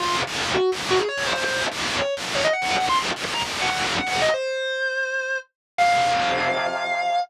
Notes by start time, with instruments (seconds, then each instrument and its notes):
0.00 overdriven guitar F2 C3 F3, distortion guitar F4
0.27 overdriven guitar F2 C3 F3
0.54 distortion guitar F#4
0.72 overdriven guitar F#2 C#3 F#3
0.90 distortion guitar F#4
0.99 distortion guitar G#4
1.08 distortion guitar C#5
1.17 overdriven guitar F#2 C#3 F#3
1.27 distortion guitar C5
1.36 overdriven guitar F#2 C#3 F#3
1.45 overdriven guitar F2 C3 F3, distortion guitar C5
1.72 overdriven guitar F2 C3 F3
1.99 distortion guitar C#5
2.17 overdriven guitar F#2 C#3 F#3
2.35 distortion guitar C#5
2.44 distortion guitar D#5
2.53 distortion guitar F#5
2.62 overdriven guitar F#2 C#3 F#3
2.71 distortion guitar F#5
2.80 overdriven guitar F#2 C#3 F#3
2.89 overdriven guitar F2 C3 F3, distortion guitar C6
3.16 overdriven guitar F2 C3 F3
3.25 overdriven guitar F2 C3 F3
3.34 overdriven guitar F2 C3 F3, distortion guitar A#5
3.43 overdriven guitar F#2 C#3 F#3
3.62 distortion guitar F#5
3.70 overdriven guitar F#2 C#3 F#3
3.98 distortion guitar F#5
4.07 overdriven guitar F#2 C#3 F#3, distortion guitar F#5
4.22 distortion guitar D#5
4.34 distortion guitar C5
5.78 overdriven guitar F2 C3 F3, distortion guitar F5